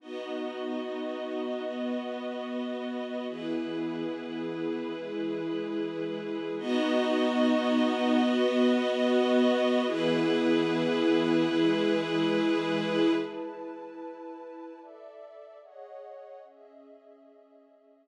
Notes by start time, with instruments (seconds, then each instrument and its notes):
0.00 pad 2 (warm) B3 D#4 F#4, string ensemble 1 B3 F#4 D#5
1.65 pad 2 (warm) B3 F#4 B4
3.29 pad 2 (warm) E3 B3 G#4, string ensemble 1 E4 G#4 B4
4.94 pad 2 (warm) E3 G#3 G#4
6.57 pad 2 (warm) B3 D#4 F#4, string ensemble 1 B3 F#4 D#5
8.22 pad 2 (warm) B3 F#4 B4
9.86 pad 2 (warm) E3 B3 G#4, string ensemble 1 E4 G#4 B4
11.50 pad 2 (warm) E3 G#3 G#4
13.16 pad 2 (warm) E4 B4 A5
14.78 pad 2 (warm) A4 D5 E5
15.62 pad 2 (warm) G#4 C#5 D#5 F#5
16.44 pad 2 (warm) C#4 G#4 D#5 E5
18.07 pad 2 (warm) E4